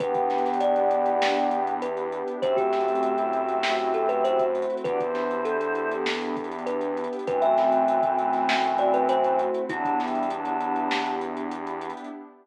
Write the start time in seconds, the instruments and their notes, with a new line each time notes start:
0.00 synth bass 1 E2, pad 2 (warm) B3 D4 E4 G4, choir aahs B3 G4, kalimba B4, kick, closed hi-hat
0.15 kick, closed hi-hat
0.30 pad 2 (warm) D4, snare, closed hi-hat
0.38 closed hi-hat
0.45 snare, closed hi-hat
0.53 closed hi-hat
0.60 pad 2 (warm) E4, kalimba D5, closed hi-hat
0.76 closed hi-hat
0.91 pad 2 (warm) G4, closed hi-hat
1.06 closed hi-hat
1.21 pad 2 (warm) E4, snare
1.36 closed hi-hat
1.51 pad 2 (warm) D4, closed hi-hat
1.67 closed hi-hat
1.81 pad 2 (warm) B3, kalimba B4, closed hi-hat
1.97 closed hi-hat
2.12 pad 2 (warm) D4, closed hi-hat
2.28 closed hi-hat
2.42 synth bass 1 F#2, pad 2 (warm) A3 C4 E4 F#4, choir aahs G4 E5, kalimba C5, kick, closed hi-hat
2.57 kalimba G4, kick, closed hi-hat
2.73 pad 2 (warm) C4, snare, closed hi-hat
2.81 closed hi-hat
2.88 closed hi-hat
2.95 closed hi-hat
3.03 pad 2 (warm) E4, closed hi-hat
3.18 closed hi-hat
3.33 pad 2 (warm) F#4, closed hi-hat
3.49 closed hi-hat
3.63 pad 2 (warm) E4, snare
3.79 closed hi-hat
3.94 pad 2 (warm) C4, kalimba A4, closed hi-hat
4.09 kalimba B4, closed hi-hat
4.24 pad 2 (warm) A3, kalimba C5, closed hi-hat
4.39 kick, closed hi-hat
4.55 pad 2 (warm) C4, closed hi-hat
4.62 closed hi-hat
4.70 closed hi-hat
4.77 closed hi-hat
4.84 synth bass 1 E2, pad 2 (warm) B3 D4 E4 G4, choir aahs F#4 D5, kalimba B4, kick, closed hi-hat
5.00 choir aahs E4 C5, kick, closed hi-hat
5.15 pad 2 (warm) D4, snare, closed hi-hat
5.31 closed hi-hat
5.45 pad 2 (warm) E4, kalimba A4, closed hi-hat
5.61 closed hi-hat
5.75 pad 2 (warm) G4, closed hi-hat
5.92 closed hi-hat
6.05 pad 2 (warm) E4, snare
6.21 closed hi-hat
6.37 pad 2 (warm) D4, kick, closed hi-hat
6.44 closed hi-hat
6.52 closed hi-hat
6.58 closed hi-hat
6.66 pad 2 (warm) B3, kalimba B4, closed hi-hat
6.81 closed hi-hat
6.97 pad 2 (warm) D4, closed hi-hat
7.04 closed hi-hat
7.13 closed hi-hat
7.19 closed hi-hat
7.27 synth bass 1 F#2, choir aahs E3 C4, pad 2 (warm) A3 C4 E4 F#4, kalimba B4, kick, closed hi-hat
7.42 kalimba E5, closed hi-hat
7.57 pad 2 (warm) C4, snare, closed hi-hat
7.72 closed hi-hat
7.87 pad 2 (warm) E4, closed hi-hat
8.03 kick, closed hi-hat
8.18 pad 2 (warm) F#4, closed hi-hat
8.33 snare, closed hi-hat
8.49 pad 2 (warm) E4, snare
8.64 closed hi-hat
8.78 pad 2 (warm) C4, kalimba D5, closed hi-hat
8.94 kalimba B4, closed hi-hat
9.08 pad 2 (warm) A3, kalimba C5, closed hi-hat
9.24 closed hi-hat
9.38 pad 2 (warm) C4, closed hi-hat
9.54 closed hi-hat
9.69 synth bass 1 E2, choir aahs F#3 D4, pad 2 (warm) B3 D4 E4 G4, kalimba E4, kick, closed hi-hat
9.85 kick, closed hi-hat
9.99 choir aahs G3 E4, pad 2 (warm) D4, snare, closed hi-hat
10.08 closed hi-hat
10.15 closed hi-hat
10.23 closed hi-hat
10.30 choir aahs F#3 D4, pad 2 (warm) E4, closed hi-hat
10.45 closed hi-hat
10.60 pad 2 (warm) G4, closed hi-hat
10.76 closed hi-hat
10.91 pad 2 (warm) E4, snare
11.06 closed hi-hat
11.21 pad 2 (warm) D4, closed hi-hat
11.37 closed hi-hat
11.51 pad 2 (warm) B3, closed hi-hat
11.67 closed hi-hat
11.81 pad 2 (warm) D4, closed hi-hat
11.90 closed hi-hat
11.97 closed hi-hat
12.04 closed hi-hat